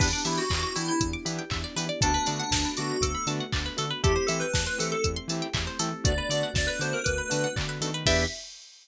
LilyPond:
<<
  \new Staff \with { instrumentName = "Electric Piano 2" } { \time 4/4 \key e \minor \tempo 4 = 119 d'8 e'16 fis'8 fis'16 e'16 e'16 r2 | d'8 d'4 fis'8 a'8 r4. | g'8 a'16 b'8 b'16 a'16 a'16 r2 | d''8 d''16 r16 d''16 b'16 c''16 ais'16 b'4 r4 |
e''4 r2. | }
  \new Staff \with { instrumentName = "Lead 2 (sawtooth)" } { \time 4/4 \key e \minor <b d' e' g'>8 <b d' e' g'>4 <b d' e' g'>4 <b d' e' g'>4 <b d' e' g'>8 | <a b d' fis'>8 <a b d' fis'>4 <a b d' fis'>4 <a b d' fis'>4 <a b d' fis'>8 | <a c' e' g'>8 <a c' e' g'>4 <a c' e' g'>4 <a c' e' g'>4 <a c' e' g'>8 | <a b d' fis'>8 <a b d' fis'>4 <a b d' fis'>4 <a b d' fis'>4 <a b d' fis'>8 |
<b d' e' g'>4 r2. | }
  \new Staff \with { instrumentName = "Pizzicato Strings" } { \time 4/4 \key e \minor b'16 d''16 e''16 g''16 b''16 d'''16 e'''16 g'''16 e'''16 d'''16 b''16 g''16 e''16 d''16 b'16 d''16 | a'16 b'16 d''16 fis''16 a''16 b''16 d'''16 fis'''16 d'''16 b''16 a''16 fis''16 d''16 b'16 a'16 b'16 | a'16 c''16 e''16 g''16 a''16 c'''16 e'''16 g'''16 e'''16 c'''16 a''16 g''16 e''16 c''16 a'8~ | a'16 b'16 d''16 fis''16 a''16 b''16 d'''16 fis'''16 d'''16 b''16 a''16 fis''16 d''16 b'16 a'16 b'16 |
<b' d'' e'' g''>4 r2. | }
  \new Staff \with { instrumentName = "Synth Bass 1" } { \clef bass \time 4/4 \key e \minor e,8 e8 e,8 e8 e,8 e8 e,8 e8 | d,8 d8 d,8 d8 d,8 d8 d,8 d8 | e,8 e8 e,8 e8 e,8 e8 e,8 e8 | d,8 d8 d,8 d8 d,8 d8 d8 dis8 |
e,4 r2. | }
  \new Staff \with { instrumentName = "String Ensemble 1" } { \time 4/4 \key e \minor <b d' e' g'>1 | <a b d' fis'>1 | <a c' e' g'>1 | <a b d' fis'>1 |
<b d' e' g'>4 r2. | }
  \new DrumStaff \with { instrumentName = "Drums" } \drummode { \time 4/4 <cymc bd>8 hho8 <hc bd>8 hho8 <hh bd>8 hho8 <hc bd>8 hho8 | <hh bd>8 hho8 <bd sn>8 hho8 <hh bd>8 hho8 <hc bd>8 hho8 | <hh bd>8 hho8 <bd sn>8 hho8 <hh bd>8 hho8 <hc bd>8 hho8 | <hh bd>8 hho8 <bd sn>8 hho8 <hh bd>8 hho8 <hc bd>8 hho8 |
<cymc bd>4 r4 r4 r4 | }
>>